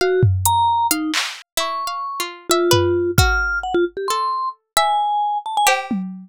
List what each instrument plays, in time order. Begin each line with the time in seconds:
0.01 vibraphone F#4, harpsichord F5
0.23 floor tom
0.45 vibraphone A#5, closed hi-hat
0.91 vibraphone D#4, harpsichord F5, closed hi-hat
1.14 clap
1.57 harpsichord E4, vibraphone C#6
1.87 harpsichord F5
2.20 harpsichord F4
2.50 vibraphone F4, harpsichord E5
2.71 harpsichord B4, floor tom
3.18 harpsichord F#4, vibraphone F6, kick
3.63 vibraphone F#5
3.74 vibraphone F4
3.97 vibraphone G4
4.08 harpsichord A4, vibraphone C6
4.77 harpsichord E5, vibraphone G#5
5.46 vibraphone A5
5.57 vibraphone G#5
5.67 harpsichord G4, cowbell
5.91 high tom